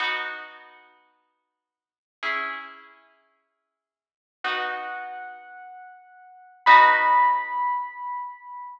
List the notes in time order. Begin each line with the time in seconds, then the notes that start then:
0.00 B3 D#4 F#4
2.23 C#4 E4 G#4
4.44 B3 D#4 F#4 F#5
6.66 B3 D#4 F#4 B5